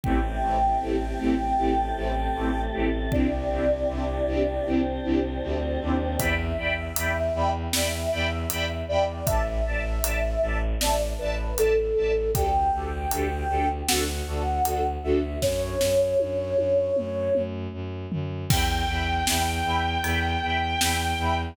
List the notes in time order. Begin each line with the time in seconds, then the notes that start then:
0.04 A1 A3 C4 E4 G4 G5, kick
0.42 A1 A3 C4 E4 G4
0.80 A1 A3 C4 E4 G4
1.19 A1 A3 C4 E4 G4
1.58 A1 A3 C4 E4 G4 A4
1.96 A1 A3 C4 E4 G4
2.35 A1 A3 C4 E4 G4
2.73 A1 A3 C4 E4 G4
3.12 C2 C4 D4 E4 G4 D5, kick
3.50 C2 C4 D4 E4 G4
3.88 C2 C4 D4 E4 G4
4.26 C2 C4 D4 E4 G4
4.66 C2 C4 D4 E4 G4 C5
5.04 C2 C4 D4 E4 G4
5.42 D2 C4 D4 E4 G4
5.81 D#2 C4 D4 E4 G4
6.19 E2 D5 E5 G5 B5, kick, closed hi-hat
6.58 E2 D5 E5 G5 B5
6.96 E2 D5 E5 G5 B5, closed hi-hat
7.34 E2 D5 E5 G5 B5
7.73 E2 D5 E5 G5 B5, snare
8.12 E2 D5 E5 G5 B5
8.50 E2 D5 E5 G5 B5, closed hi-hat
8.88 E2 D5 E5 G5 B5
9.26 A1 D5 E5 A5, kick, closed hi-hat
9.66 A1 D5 E5 A5
10.03 A1 D5 E5 A5, closed hi-hat
10.42 A1 D5 E5 A5
10.81 A1 D5 E5 A5, snare
11.19 A1 B4 D5 E5 A5
11.57 A1 A4 D5 E5 A5, closed hi-hat
11.96 A1 D5 E5 A5
12.35 D2 D4 G4 A4 G5, kick, closed hi-hat
12.73 D2 D4 G4 A4
13.11 D2 D4 G4 A4, closed hi-hat
13.49 D2 D4 G4 A4
13.88 D2 D4 F#4 A4 F#5, snare
14.27 D2 D4 F#4 A4
14.65 D2 D4 F#4 A4, closed hi-hat
15.03 D2 D4 F#4 A4 E5
15.42 F#2 C#5, kick, snare
15.81 F#2, snare
16.20 F#2, high tom
16.57 F#2, high tom
16.96 F#2, mid tom
17.35 F#2, mid tom
17.73 F#2
18.12 F#2, floor tom
18.49 E2 E5 G5 B5, kick, crash
18.88 E2 E5 G5 B5
19.27 E2 E5 G5 B5, snare
19.64 E2 E5 G5 B5
20.04 E2 E5 G5 B5, ride
20.42 E2 E5 G5 B5
20.81 E2 E5 G5 B5, snare
21.18 E2 E5 G5 B5